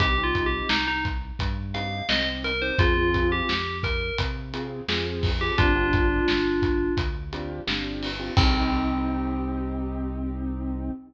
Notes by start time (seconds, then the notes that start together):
0.00 C2 C4 D#4 G4, kick, closed hi-hat
0.18 C4 D#4 G4
0.23 F4
0.35 kick, closed hi-hat
0.46 G4
0.69 C2 D#4, snare
0.88 D#4
1.05 kick, closed hi-hat
1.39 G2, kick, closed hi-hat
1.74 C4 D#4 G4 F5, closed hi-hat
2.09 C2 C4 D#4 G4 D#5, snare
2.44 A#4, closed hi-hat
2.62 C4 D#4 G4 C5
2.78 F2 C4 F4 G#4, kick, closed hi-hat
2.97 C4 F4 G#4
3.14 kick, closed hi-hat
3.32 G4
3.49 F2, snare
3.83 A#4, kick, closed hi-hat
4.18 C3, kick, closed hi-hat
4.53 C4 F4 G#4, closed hi-hat
4.88 F2 C4 F4 G#4, snare
5.23 kick, open hi-hat
5.41 C4 F4 G4 G#4
5.58 G1 C4 D4 F4 G4, kick, closed hi-hat
5.75 C4 D4 F4 G4
5.93 kick, closed hi-hat
6.28 G1, snare
6.62 kick, closed hi-hat
6.97 D2, kick, closed hi-hat
7.33 C4 D4 F4 G4, closed hi-hat
7.67 G1 C4 D4 F4 G4, snare
8.03 open hi-hat
8.19 C4 D4 F4 G4
8.37 C2 C4 D#4 G4, kick, crash